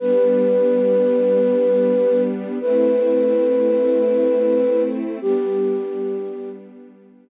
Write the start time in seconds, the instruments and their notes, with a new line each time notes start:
0.00 string ensemble 1 G3 B3 D4, flute B4
2.61 string ensemble 1 A3 C4 E4, flute B4
5.22 string ensemble 1 G3 B3 D4, flute G4